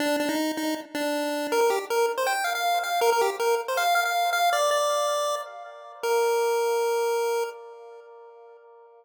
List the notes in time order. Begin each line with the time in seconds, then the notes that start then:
0.00 D4
0.20 D4
0.29 D#4
0.57 D#4
0.95 D4
1.52 A#4
1.61 A#4
1.70 G4
1.90 A#4
2.18 C5
2.27 G5
2.44 F5
2.55 F5
2.84 F5
3.01 A#4
3.12 A#4
3.21 G4
3.40 A#4
3.68 C5
3.77 F5
3.95 F5
4.05 F5
4.33 F5
4.53 D5
4.71 D5
6.03 A#4